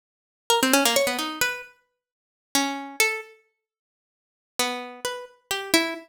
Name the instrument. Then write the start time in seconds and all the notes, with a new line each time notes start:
harpsichord
0.50 A#4
0.63 C4
0.73 C#4
0.85 A#3
0.96 C#5
1.07 B3
1.19 D#4
1.41 B4
2.55 C#4
3.00 A4
4.59 B3
5.05 B4
5.51 G4
5.74 E4